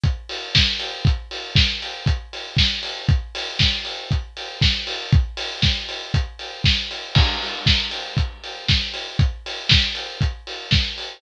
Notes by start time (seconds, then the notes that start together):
0.04 kick, closed hi-hat
0.29 open hi-hat
0.55 kick, snare
0.80 open hi-hat
1.05 kick, closed hi-hat
1.31 open hi-hat
1.56 kick, snare
1.82 open hi-hat
2.06 kick, closed hi-hat
2.33 open hi-hat
2.57 kick, snare
2.83 open hi-hat
3.09 kick, closed hi-hat
3.35 open hi-hat
3.59 kick, snare
3.85 open hi-hat
4.11 kick, closed hi-hat
4.37 open hi-hat
4.62 kick, snare
4.87 open hi-hat
5.12 kick, closed hi-hat
5.37 open hi-hat
5.62 kick, snare
5.89 open hi-hat
6.14 kick, closed hi-hat
6.39 open hi-hat
6.64 kick, snare
6.91 open hi-hat
7.15 kick, crash
7.42 open hi-hat
7.66 kick, snare
7.91 open hi-hat
8.17 kick, closed hi-hat
8.44 open hi-hat
8.69 kick, snare
8.94 open hi-hat
9.19 kick, closed hi-hat
9.46 open hi-hat
9.69 kick, snare
9.95 open hi-hat
10.21 kick, closed hi-hat
10.47 open hi-hat
10.71 kick, snare
10.98 open hi-hat